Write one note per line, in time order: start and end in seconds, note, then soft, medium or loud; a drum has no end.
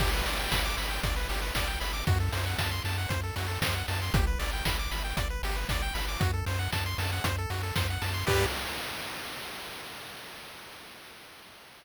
0.00 0.22 G1 loud
0.00 0.10 G4 loud
0.00 kick loud
0.00 crash loud
0.14 0.25 B4 medium
0.26 0.48 G1 medium
0.26 0.38 D5 medium
0.26 open hi-hat medium
0.39 0.51 G5 medium
0.51 0.74 G1 medium
0.51 0.62 B5 medium
0.51 kick medium
0.51 snare loud
0.65 0.76 D6 medium
0.77 1.00 G1 medium
0.77 0.89 B5 medium
0.77 open hi-hat medium
0.89 1.01 G5 medium
1.03 1.25 G1 loud
1.03 1.15 D5 medium
1.03 kick loud
1.03 closed hi-hat loud
1.16 1.28 B4 medium
1.29 1.51 G1 medium
1.29 1.41 G4 medium
1.29 open hi-hat medium
1.42 1.54 B4 medium
1.55 1.77 G1 medium
1.55 1.68 D5 medium
1.55 kick medium
1.55 snare loud
1.67 1.79 G5 medium
1.80 2.03 G1 medium
1.80 1.92 B5 medium
1.80 open hi-hat medium
1.93 2.05 D6 medium
2.07 2.29 F#2 loud
2.07 2.19 F#4 loud
2.07 kick loud
2.07 closed hi-hat loud
2.20 2.32 A4 medium
2.32 2.55 F#2 loud
2.32 2.45 C5 medium
2.32 open hi-hat medium
2.46 2.57 F#5 medium
2.58 2.80 F#2 medium
2.58 2.70 A5 medium
2.58 kick medium
2.58 snare loud
2.71 2.83 C6 medium
2.84 3.06 F#2 loud
2.84 2.97 A5 medium
2.84 open hi-hat medium
2.98 3.09 F#5 medium
3.09 3.32 F#2 medium
3.09 3.21 C5 medium
3.09 kick medium
3.09 closed hi-hat loud
3.23 3.35 A4 medium
3.36 3.58 F#2 medium
3.36 3.47 F#4 medium
3.36 open hi-hat medium
3.48 3.59 A4 medium
3.62 3.84 F#2 medium
3.62 3.75 C5 medium
3.62 kick medium
3.62 snare loud
3.75 3.86 F#5 medium
3.88 4.10 F#2 medium
3.88 4.00 A5 medium
3.88 open hi-hat medium
4.02 4.13 C6 medium
4.13 4.35 G1 loud
4.13 4.26 G4 medium
4.13 kick loud
4.13 closed hi-hat loud
4.27 4.39 B4 medium
4.39 4.61 G1 medium
4.39 4.51 D5 medium
4.39 open hi-hat medium
4.53 4.65 G5 medium
4.65 4.87 G1 medium
4.65 4.77 B5 medium
4.65 kick medium
4.65 snare loud
4.79 4.91 D6 medium
4.91 5.13 G1 medium
4.91 5.03 B5 medium
4.91 open hi-hat medium
5.04 5.16 G5 medium
5.17 5.39 G1 medium
5.17 5.28 D5 medium
5.17 kick loud
5.17 closed hi-hat loud
5.30 5.42 B4 medium
5.43 5.65 G1 loud
5.43 5.56 G4 medium
5.43 open hi-hat medium
5.56 5.68 B4 medium
5.69 5.91 G1 medium
5.69 5.82 D5 medium
5.69 kick loud
5.69 snare loud
5.82 5.94 G5 medium
5.94 6.17 G1 medium
5.94 6.06 B5 medium
5.94 open hi-hat medium
6.09 6.20 D6 medium
6.20 6.43 F#2 loud
6.20 6.31 F#4 loud
6.20 kick loud
6.20 closed hi-hat loud
6.34 6.45 A4 medium
6.46 6.68 F#2 loud
6.46 6.59 C5 medium
6.46 open hi-hat medium
6.59 6.71 F#5 medium
6.73 6.95 F#2 medium
6.73 6.84 A5 medium
6.73 kick medium
6.73 snare loud
6.86 6.98 C6 medium
6.98 7.20 F#2 loud
6.98 7.11 A5 medium
6.98 open hi-hat medium
7.13 7.24 F#5 medium
7.24 7.46 F#2 medium
7.24 7.36 C5 medium
7.24 kick medium
7.24 closed hi-hat loud
7.38 7.50 A4 medium
7.50 7.72 F#2 medium
7.50 7.62 F#4 medium
7.50 open hi-hat medium
7.63 7.75 A4 medium
7.76 7.98 F#2 medium
7.76 7.87 C5 medium
7.76 kick medium
7.76 snare loud
7.90 8.02 F#5 medium
8.02 8.24 F#2 medium
8.02 8.13 A5 medium
8.02 open hi-hat medium
8.14 8.25 C6 medium
8.27 8.46 G2 loud
8.27 8.45 G4 medium
8.27 8.46 G4 loud
8.27 8.45 B4 loud
8.27 8.45 D5 loud
8.27 kick loud
8.27 crash loud